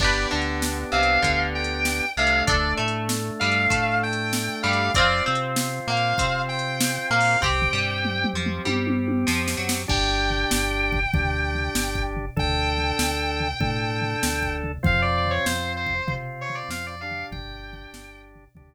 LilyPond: <<
  \new Staff \with { instrumentName = "Distortion Guitar" } { \time 4/4 \key g \mixolydian \tempo 4 = 97 d''8 r4 f''4 g''4 f''8 | d''8 r4 f''4 g''4 f''8 | d''8 r4 f''4 g''4 f''8 | g''4. r2 r8 |
g''1 | g''1 | f''16 d''16 d''16 des''16 c''8 c''8. r16 cis''16 d''16 f''16 d''16 f''8 | g''4. r2 r8 | }
  \new Staff \with { instrumentName = "Acoustic Guitar (steel)" } { \time 4/4 \key g \mixolydian <d' g' b'>8 d4 c8 d4. c8 | <d' a'>8 a4 g8 a4. g8 | <c' f'>8 c'4 ais8 c'4. ais8 | <c' g'>8 g4 f8 g4 f8 fis8 |
r1 | r1 | r1 | r1 | }
  \new Staff \with { instrumentName = "Drawbar Organ" } { \time 4/4 \key g \mixolydian <b d' g'>2.~ <b d' g'>8 <a d'>8~ | <a d'>1 | <c' f'>1 | <c' g'>1 |
<d' g'>2 <d' g'>2 | <d' a'>2 <d' a'>2 | <c' f'>2 <c' f'>4. <d' g'>8~ | <d' g'>2 <d' g'>2 | }
  \new Staff \with { instrumentName = "Synth Bass 1" } { \clef bass \time 4/4 \key g \mixolydian g,,8 d,4 c,8 d,4. c,8 | d,8 a,4 g,8 a,4. g,8 | f,8 c4 ais,8 c4. ais,8 | c,8 g,4 f,8 g,4 f,8 fis,8 |
g,,4 g,,4 d,4 g,,4 | d,4 d,4 a,4 d,4 | f,4 f,4 c4 f,4 | g,,4 g,,4 d,4 r4 | }
  \new DrumStaff \with { instrumentName = "Drums" } \drummode { \time 4/4 \tuplet 3/2 { <cymc bd>8 r8 hh8 sn8 r8 hh8 <hh bd>8 r8 hh8 sn8 r8 hh8 } | \tuplet 3/2 { <hh bd>8 r8 hh8 sn8 r8 hh8 <hh bd>8 r8 hh8 sn8 r8 hh8 } | \tuplet 3/2 { <hh bd>8 r8 hh8 sn8 r8 hh8 <hh bd>8 r8 hh8 sn8 r8 hho8 } | \tuplet 3/2 { <bd tomfh>8 tomfh8 r8 toml8 toml8 toml8 tommh8 tommh8 tommh8 sn8 sn8 sn8 } |
\tuplet 3/2 { <cymc bd>8 r8 tomfh8 sn8 r8 <bd tomfh>8 <bd tomfh>8 r8 tomfh8 sn8 bd8 tomfh8 } | \tuplet 3/2 { <bd tomfh>8 r8 tomfh8 sn8 r8 tomfh8 <bd tomfh>8 r8 tomfh8 sn8 bd8 tomfh8 } | \tuplet 3/2 { <bd tomfh>8 r8 tomfh8 sn8 r8 <bd tomfh>8 <bd tomfh>8 r8 tomfh8 sn8 r8 tomfh8 } | \tuplet 3/2 { <bd tomfh>8 r8 <bd tomfh>8 sn8 r8 tomfh8 } <bd tomfh>4 r4 | }
>>